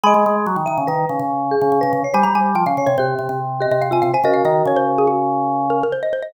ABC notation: X:1
M:5/4
L:1/16
Q:1/4=143
K:Abmix
V:1 name="Xylophone"
[a_c']10 z10 | a b a2 =g f z d c6 e e f a f a | e f e2 d c z A G6 B B c e c e |]
V:2 name="Marimba"
e3 z3 _f2 _c4 z2 A3 c2 d | c3 z3 d2 =G4 z2 G3 F2 c | [GB]14 z6 |]
V:3 name="Drawbar Organ" clef=bass
A, A, A,2 G, E, E, D, E,2 D, D,4 D, D, D, D, z | =G, G, G,2 F, D, D, C, C,2 C, C,4 C, C, C, C, z | D,2 E,2 D,12 z4 |]